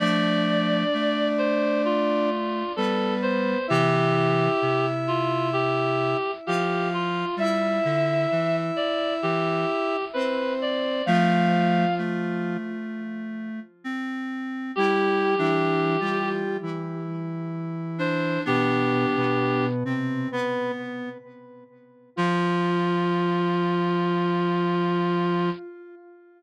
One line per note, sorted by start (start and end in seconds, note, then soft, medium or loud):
0.00 0.84 F3 medium
0.00 0.84 A3 medium
0.00 2.30 D4 loud
0.00 1.27 D5 loud
0.00 2.30 D5 loud
0.94 2.63 A3 medium
1.38 1.82 C5 loud
1.85 2.72 F4 medium
2.76 3.55 G3 medium
2.76 3.58 B3 medium
2.76 3.14 A4 loud
2.76 3.58 B4 loud
3.22 3.66 C5 loud
3.68 4.48 C3 medium
3.68 4.48 E3 medium
3.68 6.17 E4 loud
3.68 4.86 G4 loud
3.68 6.17 E5 loud
4.62 6.15 C3 medium
5.08 5.49 F4 loud
5.53 6.31 G4 loud
6.46 7.24 F3 medium
6.46 7.25 F4 loud
6.46 6.88 G4 loud
6.46 7.25 F5 loud
6.94 7.35 F4 loud
7.36 7.80 G3 medium
7.36 9.97 E4 loud
7.36 8.56 E5 loud
7.36 9.97 E5 loud
7.85 8.26 D3 medium
8.32 8.71 E3 medium
8.76 9.14 D5 loud
9.22 9.65 E3 medium
9.22 10.05 G4 loud
10.13 11.02 C4 medium
10.13 10.53 B4 loud
10.13 11.02 C5 loud
10.62 11.04 D5 loud
11.06 11.85 F3 medium
11.06 12.57 F3 loud
11.06 11.85 A3 medium
11.06 12.57 F4 loud
11.06 11.94 F5 loud
11.98 13.60 A3 medium
13.84 14.72 C4 medium
14.75 15.35 G3 loud
14.75 15.34 E4 medium
14.75 16.30 G4 loud
14.75 15.35 G4 loud
15.38 15.97 E3 loud
15.38 15.96 D4 medium
15.38 15.97 E4 loud
16.00 16.57 G3 medium
16.00 16.57 F4 medium
16.00 16.57 G4 loud
16.62 18.38 E3 medium
16.62 18.38 E4 medium
17.98 18.43 D4 medium
17.98 18.41 C5 loud
18.45 19.06 B2 medium
18.45 19.66 B3 medium
18.45 19.06 B3 loud
18.45 19.66 D4 medium
18.45 19.65 G4 loud
19.16 19.84 B2 loud
19.16 19.84 B3 loud
19.84 20.28 C3 medium
19.84 20.28 C4 medium
19.84 20.29 C4 medium
20.32 20.72 B3 loud
20.32 21.09 B3 medium
20.32 20.72 B4 loud
22.16 25.50 F3 loud
22.16 25.49 F4 loud
22.16 25.50 F4 loud